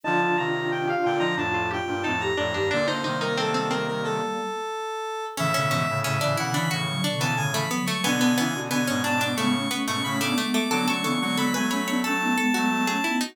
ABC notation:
X:1
M:4/4
L:1/16
Q:1/4=90
K:Bb
V:1 name="Lead 1 (square)"
a2 b2 g f g b a2 g2 a b3 | d c2 B A2 B B A8 | [K:A] e4 e2 f b c'3 a g b2 c' | g4 g2 a d' c'3 c' b d'2 d' |
d' c' c' c' b g b2 a8 |]
V:2 name="Pizzicato Strings"
E2 F3 G F E D F G2 E2 D D | D E E E C C C6 z4 | [K:A] C C C z C D E D F2 D B, z A, B, A, | B, B, B, z B, C D D A,2 B, A, z A, A, A, |
A A A z A B c c A2 A F z G E ^D |]
V:3 name="Flute"
[DF]8 [DF]2 [DF] [DF] [CE] [EG] z [EG] | [B,D]2 [G,B,]10 z4 | [K:A] [C,E,] [B,,D,] [C,E,] [A,,C,] [A,,C,] [A,,C,] [B,,D,] [C,E,] [C,E,] [D,F,] [B,,D,]3 [C,E,] [D,F,] [F,A,] | [B,D]2 [CE] [DF] [B,D]3 [B,D] [G,B,] [A,C] [A,C]2 [A,C] [B,D] [G,B,]2 |
[B,D] [A,C] [B,D] [G,B,] [G,B,] [G,B,] [A,C] [B,D] [A,C] [B,^D] [G,B,]3 [A,C] [B,D] [DF] |]
V:4 name="Brass Section"
[D,F,] [D,F,] [C,E,]4 [B,,D,] [D,F,] [F,,A,,]3 [G,,B,,] [F,,A,,]2 [F,,A,,] [E,,G,,] | [B,,D,] [B,,D,] [C,E,]8 z6 | [K:A] [A,,C,] [A,,C,] [G,,B,,] [A,,C,] [A,,C,] [C,E,] [C,E,]2 [A,,C,]2 z [C,E,] [A,,C,]2 z2 | [B,,D,] [B,,D,] [C,E,] [B,,D,] [B,,D,] [G,,B,,] [G,,B,,]2 [A,,C,]2 z [G,,B,,] [A,,C,]2 z2 |
[D,F,] [D,F,] [C,E,] [D,F,] [D,F,] [F,A,] [F,A,]2 [F,A,]2 z [F,A,] [F,A,]2 z2 |]